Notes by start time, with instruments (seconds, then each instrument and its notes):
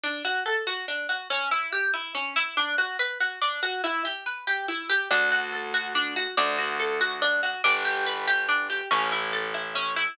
0.04 orchestral harp D4
0.25 orchestral harp F#4
0.46 orchestral harp A4
0.67 orchestral harp F#4
0.88 orchestral harp D4
1.09 orchestral harp F#4
1.30 orchestral harp C#4
1.51 orchestral harp E4
1.73 orchestral harp G4
1.94 orchestral harp E4
2.15 orchestral harp C#4
2.36 orchestral harp E4
2.57 orchestral harp D4
2.78 orchestral harp F#4
2.99 orchestral harp B4
3.20 orchestral harp F#4
3.42 orchestral harp D4
3.63 orchestral harp F#4
3.84 orchestral harp E4
4.05 orchestral harp G4
4.26 orchestral harp B4
4.47 orchestral harp G4
4.68 orchestral harp E4
4.90 orchestral harp G4
5.11 electric bass (finger) D2, orchestral harp D4
5.32 orchestral harp F#4
5.53 orchestral harp A4
5.74 orchestral harp F#4
5.95 orchestral harp D4
6.16 orchestral harp F#4
6.37 electric bass (finger) D2, orchestral harp D4
6.58 orchestral harp F#4
6.80 orchestral harp A4
7.01 orchestral harp F#4
7.22 orchestral harp D4
7.43 orchestral harp F#4
7.64 electric bass (finger) G1, orchestral harp D4
7.85 orchestral harp G4
8.06 orchestral harp B4
8.28 orchestral harp G4
8.49 orchestral harp D4
8.70 orchestral harp G4
8.91 electric bass (finger) A1, orchestral harp C#4
9.12 orchestral harp E4
9.33 orchestral harp A4
9.54 orchestral harp E4
9.75 orchestral harp C#4
9.96 orchestral harp E4